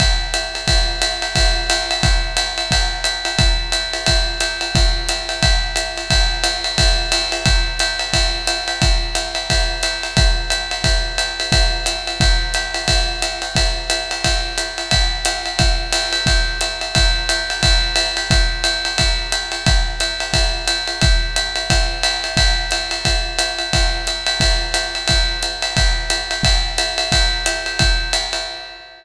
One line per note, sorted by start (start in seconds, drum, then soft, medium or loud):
0.00 kick medium
0.00 ride medium
0.34 hi-hat pedal medium
0.34 ride medium
0.55 ride medium
0.68 kick medium
0.68 ride medium
1.02 hi-hat pedal medium
1.02 ride medium
1.22 ride medium
1.35 kick medium
1.35 ride medium
1.70 hi-hat pedal medium
1.70 ride medium
1.91 ride medium
2.03 kick medium
2.03 ride medium
2.37 hi-hat pedal medium
2.37 ride medium
2.58 ride medium
2.71 kick soft
2.71 ride medium
3.04 hi-hat pedal medium
3.04 ride medium
3.25 ride medium
3.39 kick medium
3.39 ride medium
3.72 hi-hat pedal medium
3.72 ride medium
3.94 ride medium
4.06 kick soft
4.06 ride medium
4.40 hi-hat pedal medium
4.40 ride medium
4.61 ride medium
4.75 kick medium
4.75 ride medium
5.09 hi-hat pedal medium
5.09 ride medium
5.29 ride medium
5.43 kick medium
5.43 ride medium
5.76 hi-hat pedal medium
5.76 ride medium
5.98 ride medium
6.10 kick medium
6.10 ride medium
6.44 hi-hat pedal medium
6.44 ride medium
6.64 ride medium
6.78 kick medium
6.78 ride medium
7.12 hi-hat pedal medium
7.12 ride medium
7.32 ride medium
7.46 kick medium
7.46 ride medium
7.79 hi-hat pedal medium
7.79 ride medium
7.99 ride medium
8.13 kick soft
8.13 ride medium
8.47 hi-hat pedal medium
8.47 ride medium
8.68 ride medium
8.82 kick medium
8.82 ride medium
9.15 hi-hat pedal medium
9.15 ride medium
9.35 ride medium
9.50 kick soft
9.50 ride medium
9.83 hi-hat pedal medium
9.83 ride medium
10.03 ride medium
10.17 kick medium
10.17 ride medium
10.50 hi-hat pedal medium
10.50 ride medium
10.71 ride medium
10.84 kick soft
10.84 ride medium
11.18 hi-hat pedal medium
11.18 ride medium
11.40 ride medium
11.52 kick medium
11.52 ride medium
11.86 hi-hat pedal medium
11.86 ride medium
12.07 ride medium
12.20 kick medium
12.20 ride medium
12.54 hi-hat pedal medium
12.54 ride medium
12.74 ride medium
12.88 kick soft
12.88 ride medium
13.22 hi-hat pedal medium
13.22 ride medium
13.42 ride medium
13.55 kick soft
13.55 ride medium
13.90 hi-hat pedal medium
13.90 ride medium
14.11 ride medium
14.24 kick soft
14.24 ride medium
14.58 hi-hat pedal medium
14.58 ride medium
14.78 ride medium
14.91 kick soft
14.91 ride medium
15.25 hi-hat pedal medium
15.25 ride medium
15.46 ride medium
15.59 kick medium
15.59 ride medium
15.93 hi-hat pedal medium
15.93 ride medium
16.13 ride medium
16.26 kick medium
16.26 ride medium
16.61 hi-hat pedal medium
16.61 ride medium
16.81 ride medium
16.95 kick medium
16.95 ride medium
17.29 hi-hat pedal medium
17.29 ride medium
17.50 ride medium
17.63 kick medium
17.63 ride medium
17.96 hi-hat pedal medium
17.96 ride medium
18.17 ride medium
18.31 kick medium
18.31 ride medium
18.64 hi-hat pedal medium
18.64 ride medium
18.85 ride medium
18.98 kick soft
18.98 ride medium
19.32 hi-hat pedal medium
19.32 ride medium
19.52 ride medium
19.66 kick medium
19.66 ride medium
20.00 hi-hat pedal medium
20.00 ride medium
20.20 ride medium
20.33 kick soft
20.33 ride medium
20.68 hi-hat pedal medium
20.68 ride medium
20.87 ride medium
21.01 kick medium
21.01 ride medium
21.36 hi-hat pedal medium
21.36 ride medium
21.56 ride medium
21.70 kick soft
21.70 ride medium
22.03 hi-hat pedal medium
22.03 ride medium
22.24 ride medium
22.37 kick medium
22.37 ride medium
22.71 hi-hat pedal medium
22.71 ride medium
22.91 ride medium
23.05 kick soft
23.05 ride medium
23.39 hi-hat pedal medium
23.39 ride medium
23.59 ride medium
23.73 kick soft
23.73 ride medium
24.07 hi-hat pedal medium
24.07 ride medium
24.27 ride medium
24.40 kick medium
24.40 ride medium
24.74 hi-hat pedal medium
24.74 ride medium
24.95 ride medium
25.08 kick soft
25.08 ride medium
25.43 hi-hat pedal medium
25.43 ride medium
25.62 ride medium
25.77 kick medium
25.77 ride medium
26.10 hi-hat pedal medium
26.10 ride medium
26.31 ride medium
26.43 kick medium
26.43 ride medium
26.78 hi-hat pedal medium
26.78 ride medium
26.98 ride medium
27.12 kick soft
27.12 ride medium
27.46 hi-hat pedal medium
27.46 ride medium
27.66 ride medium
27.79 kick soft
27.79 ride medium
28.13 hi-hat pedal medium
28.13 ride medium
28.33 ride medium